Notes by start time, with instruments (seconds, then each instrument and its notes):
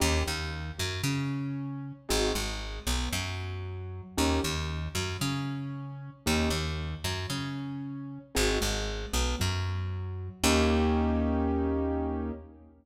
0.00 electric bass (finger) D#2, acoustic grand piano A#3 C#4 D#4 G4
0.26 electric bass (finger) D#2, acoustic grand piano D#3
0.78 electric bass (finger) F#2, acoustic grand piano F#3
1.03 electric bass (finger) C#3, acoustic grand piano C#4
2.09 electric bass (finger) G#1, acoustic grand piano C4 D#4 F#4 G#4
2.35 electric bass (finger) G#1, acoustic grand piano G#3
2.87 electric bass (finger) B1, acoustic grand piano B3
3.12 electric bass (finger) F#2, acoustic grand piano F#3
4.17 electric bass (finger) D#2, acoustic grand piano A#3 C#4 D#4 G4
4.43 electric bass (finger) D#2, acoustic grand piano D#3
4.95 electric bass (finger) F#2, acoustic grand piano F#3
5.21 electric bass (finger) C#3, acoustic grand piano C#4
6.26 electric bass (finger) D#2, acoustic grand piano A#3 C#4 D#4 G4
6.50 electric bass (finger) D#2, acoustic grand piano D#3
7.04 electric bass (finger) F#2, acoustic grand piano F#3
7.30 electric bass (finger) C#3, acoustic grand piano C#4
8.35 electric bass (finger) G#1, acoustic grand piano C4 D#4 F#4 G#4
8.61 electric bass (finger) G#1, acoustic grand piano G#3
9.13 electric bass (finger) B1, acoustic grand piano B3
9.39 electric bass (finger) F#2, acoustic grand piano F#3
10.44 electric bass (finger) D#2, acoustic grand piano A#3 C#4 D#4 G4